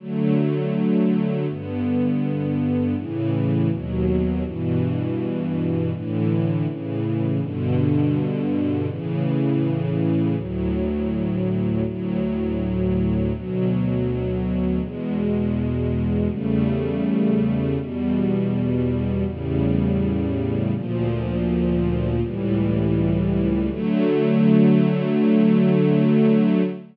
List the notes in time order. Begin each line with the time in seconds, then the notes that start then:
0.00 D3 F#3 A3
1.48 G2 D3 B3
2.96 A2 C#3 E3
3.70 D#2 B2 F#3
4.44 G2 B2 E3
5.93 A2 D3 E3
6.67 A2 C#3 E3
7.41 G2 B2 D3
8.89 A2 C#3 E3
10.37 D2 A2 F#3
11.85 D2 A2 F#3
13.33 D2 B2 F#3
14.81 E2 B2 G#3
16.30 E2 C#3 G3 A3
17.78 E2 B2 G3
19.26 E2 A2 C#3 G3
20.74 D2 A#2 F3
22.22 C#2 A2 E3 G3
23.71 D3 F#3 A3